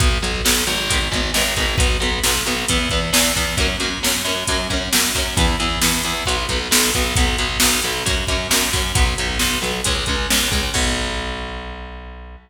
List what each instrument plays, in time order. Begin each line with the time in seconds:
0.00 electric bass (finger) B1, overdriven guitar F#3 B3, kick, closed hi-hat
0.22 electric bass (finger) B1, overdriven guitar F#3 B3, closed hi-hat
0.45 electric bass (finger) B1, overdriven guitar F#3 B3, snare
0.67 electric bass (finger) G#1, overdriven guitar F#3 B3, closed hi-hat
0.90 overdriven guitar D#3 G#3 B3, kick, closed hi-hat
1.12 electric bass (finger) G#1, overdriven guitar D#3 G#3 B3, kick, closed hi-hat
1.34 electric bass (finger) G#1, overdriven guitar D#3 G#3 B3, snare
1.56 electric bass (finger) G#1, overdriven guitar D#3 G#3 B3, kick, closed hi-hat
1.78 electric bass (finger) B1, overdriven guitar F#3 B3, kick, closed hi-hat
2.00 electric bass (finger) B1, overdriven guitar F#3 B3, closed hi-hat
2.24 electric bass (finger) B1, overdriven guitar F#3 B3, snare
2.46 electric bass (finger) B1, overdriven guitar F#3 B3, closed hi-hat
2.68 electric bass (finger) E2, overdriven guitar E3 B3, kick, closed hi-hat
2.90 electric bass (finger) E2, overdriven guitar E3 B3, kick, closed hi-hat
3.13 electric bass (finger) E2, overdriven guitar E3 B3, snare
3.36 electric bass (finger) E2, overdriven guitar E3 B3, kick, closed hi-hat
3.57 electric bass (finger) F#2, overdriven guitar F#3 A#3, kick, closed hi-hat
3.62 overdriven guitar C#4
3.80 electric bass (finger) F#2, overdriven guitar F#3 A#3, closed hi-hat
3.84 overdriven guitar C#4
4.03 electric bass (finger) F#2, overdriven guitar F#3 A#3 C#4, snare
4.25 electric bass (finger) F#2, overdriven guitar F#3 A#3, closed hi-hat
4.29 overdriven guitar C#4
4.47 electric bass (finger) F#2, overdriven guitar F#3 A#3, kick, closed hi-hat
4.52 overdriven guitar C#4
4.70 electric bass (finger) F#2, overdriven guitar F#3 A#3 C#4, kick, closed hi-hat
4.93 electric bass (finger) F#2, overdriven guitar F#3 A#3 C#4, snare
5.15 electric bass (finger) F#2, overdriven guitar F#3 A#3 C#4, kick, open hi-hat
5.37 electric bass (finger) E2, overdriven guitar E3 B3, kick, closed hi-hat
5.60 electric bass (finger) E2, overdriven guitar E3 B3, closed hi-hat
5.82 electric bass (finger) E2, overdriven guitar E3 B3, snare
6.03 electric bass (finger) E2, overdriven guitar E3 B3, closed hi-hat
6.26 electric bass (finger) B1, overdriven guitar F#3 B3, kick, closed hi-hat
6.49 electric bass (finger) B1, overdriven guitar F#3 B3, kick, closed hi-hat
6.71 electric bass (finger) B1, overdriven guitar F#3 B3, snare
6.94 electric bass (finger) B1, overdriven guitar F#3 B3, kick, closed hi-hat
7.16 electric bass (finger) B1, overdriven guitar F#3 B3, kick, closed hi-hat
7.38 electric bass (finger) B1, overdriven guitar F#3 B3, closed hi-hat
7.60 electric bass (finger) B1, overdriven guitar F#3 B3, snare
7.82 electric bass (finger) B1, overdriven guitar F#3 B3, closed hi-hat
8.06 electric bass (finger) F#2, overdriven guitar F#3 A#3 C#4, kick, closed hi-hat
8.27 electric bass (finger) F#2, overdriven guitar F#3 A#3, kick, closed hi-hat
8.32 overdriven guitar C#4
8.51 electric bass (finger) F#2, overdriven guitar F#3 A#3, snare
8.55 overdriven guitar C#4
8.73 electric bass (finger) F#2, overdriven guitar F#3 A#3 C#4, kick, open hi-hat
8.95 electric bass (finger) B1, overdriven guitar F#3 B3, kick, closed hi-hat
9.18 electric bass (finger) B1, overdriven guitar F#3 B3, closed hi-hat
9.39 electric bass (finger) B1, overdriven guitar F#3 B3, snare
9.62 electric bass (finger) B1, overdriven guitar F#3 B3, closed hi-hat
9.84 electric bass (finger) C#2, overdriven guitar G#3 C#4, kick, closed hi-hat
10.06 electric bass (finger) C#2, overdriven guitar G#3 C#4, kick, closed hi-hat
10.30 electric bass (finger) C#2, overdriven guitar G#3 C#4, snare
10.51 electric bass (finger) C#2, overdriven guitar G#3 C#4, kick, closed hi-hat
10.74 electric bass (finger) B1, overdriven guitar F#3 B3, kick, crash